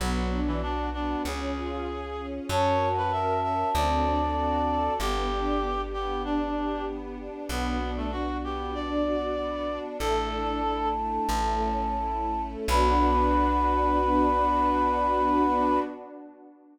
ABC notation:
X:1
M:4/4
L:1/16
Q:1/4=96
K:Bm
V:1 name="Flute"
z16 | a16 | z16 | z16 |
"^rit." a16 | b16 |]
V:2 name="Clarinet"
F,3 E, D2 D2 ^G8 | c3 B e2 e2 d8 | G6 G2 D4 z4 | B,3 A, F2 G2 d8 |
"^rit." A6 z10 | B16 |]
V:3 name="String Ensemble 1"
B,2 D2 F2 B,2 C2 ^E2 ^G2 C2 | C2 F2 ^A2 C2 =C2 D2 F2 =A2 | B,2 D2 G2 B,2 D2 G2 B,2 D2 | B,2 D2 F2 B,2 D2 F2 B,2 D2 |
"^rit." A,2 D2 E2 A,2 A,2 C2 E2 A,2 | [B,DF]16 |]
V:4 name="Electric Bass (finger)" clef=bass
B,,,8 C,,8 | F,,8 D,,8 | G,,,16 | B,,,16 |
"^rit." A,,,8 A,,,8 | B,,,16 |]
V:5 name="String Ensemble 1"
[B,DF]8 [C^E^G]8 | [CF^A]8 [=CDF=A]8 | [B,DG]16 | [B,DF]16 |
"^rit." [A,DE]8 [A,CE]8 | [B,DF]16 |]